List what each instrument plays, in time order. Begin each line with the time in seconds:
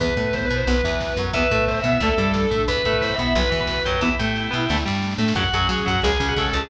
0.00 electric bass (finger) E2, overdriven guitar E3 B3, drawbar organ B3, pad 2 (warm) B3 E4, distortion guitar B4, kick, closed hi-hat
0.09 kick
0.16 electric bass (finger) A2, overdriven guitar A3, distortion guitar B4, kick, closed hi-hat
0.24 kick
0.33 drawbar organ B3, distortion guitar C5, kick, snare
0.41 kick
0.45 distortion guitar B4
0.49 electric bass (finger) B2, overdriven guitar B3, kick, closed hi-hat
0.56 distortion guitar C5, kick
0.67 electric bass (finger) B1, overdriven guitar F#3 B3, pad 2 (warm) B3 F#4, distortion guitar B4, kick, closed hi-hat
0.77 kick
0.83 electric bass (finger) E2, overdriven guitar E3, kick, snare, closed hi-hat
0.93 kick
1.00 kick, snare
1.08 kick
1.17 electric bass (finger) F#2, overdriven guitar F#3, kick, closed hi-hat
1.27 kick
1.33 electric bass (finger) E2, overdriven guitar E3 B3, pad 2 (warm) B3 E4, drawbar organ E4, distortion guitar B4, kick, closed hi-hat
1.42 kick
1.50 electric bass (finger) A2, overdriven guitar A3, distortion guitar B4, kick, closed hi-hat
1.59 kick
1.68 drawbar organ E4, distortion guitar C5, kick, snare
1.75 distortion guitar E5, kick
1.84 electric bass (finger) B2, overdriven guitar B3, kick, closed hi-hat
1.90 distortion guitar E5, kick
2.00 electric bass (finger) D2, overdriven guitar D3 A3, pad 2 (warm) A3 D4, distortion guitar A4, kick, closed hi-hat
2.10 kick
2.17 electric bass (finger) G2, overdriven guitar G3, kick, snare, closed hi-hat
2.25 kick
2.34 kick, snare
2.42 kick
2.51 electric bass (finger) A2, overdriven guitar A3, kick, closed hi-hat
2.59 kick
2.68 electric bass (finger) E2, pad 2 (warm) B3 E4, drawbar organ B4, distortion guitar B4, kick, closed hi-hat
2.77 kick
2.84 electric bass (finger) A2, overdriven guitar A3, distortion guitar B4, kick, closed hi-hat
2.93 kick
3.01 drawbar organ B4, distortion guitar C5, kick, snare
3.10 distortion guitar E5, kick
3.18 electric bass (finger) B2, overdriven guitar B3, drawbar organ B4, kick, closed hi-hat
3.24 distortion guitar E5, kick
3.34 electric bass (finger) B1, overdriven guitar F#3 B3, pad 2 (warm) B3 F#4, distortion guitar B4, drawbar organ B4, kick, closed hi-hat
3.43 kick
3.50 electric bass (finger) E2, overdriven guitar E3, kick, snare, closed hi-hat
3.60 drawbar organ B4, kick
3.67 kick, snare
3.77 kick
3.85 electric bass (finger) F#2, overdriven guitar F#3, drawbar organ G4, kick, closed hi-hat
3.94 kick
4.01 electric bass (finger) E2, overdriven guitar E3 B3, pad 2 (warm) B3 E4, drawbar organ E4, distortion guitar E4, kick, snare
4.19 electric bass (finger) A2, overdriven guitar A3, drawbar organ G4, snare
4.36 snare
4.51 electric bass (finger) B2, overdriven guitar B3, snare
4.69 electric bass (finger) D2, overdriven guitar D3 A3, pad 2 (warm) A3 D4, snare
4.77 snare
4.85 electric bass (finger) G2, overdriven guitar G3, snare
4.95 snare
5.02 snare
5.11 snare
5.18 electric bass (finger) A2, overdriven guitar A3, snare
5.28 snare
5.35 electric bass (finger) F#2, overdriven guitar C#3 F#3, pad 2 (warm) F#3 C#4, drawbar organ F#4, distortion guitar F#4, kick, crash
5.45 kick
5.53 electric bass (finger) F#2, overdriven guitar F#3, distortion guitar G#4, kick, closed hi-hat
5.61 kick
5.69 electric bass (finger) F#3, drawbar organ F#4, overdriven guitar F#4, kick, snare
5.79 kick
5.86 electric bass (finger) F#2, overdriven guitar F#3, distortion guitar F#4, drawbar organ F#4, kick, closed hi-hat
5.95 kick
6.02 electric bass (finger) C#2, overdriven guitar C#3 G#3, pad 2 (warm) G#3 C#4, drawbar organ G#4, distortion guitar G#4, kick, closed hi-hat
6.12 kick
6.19 electric bass (finger) C#2, overdriven guitar C#3, kick, snare, closed hi-hat
6.28 drawbar organ F#4, kick
6.36 electric bass (finger) C#3, overdriven guitar C#4, distortion guitar A4, kick, snare
6.46 distortion guitar A4, kick
6.53 electric bass (finger) C#2, overdriven guitar C#3, drawbar organ A4, kick, open hi-hat
6.59 distortion guitar G#4, kick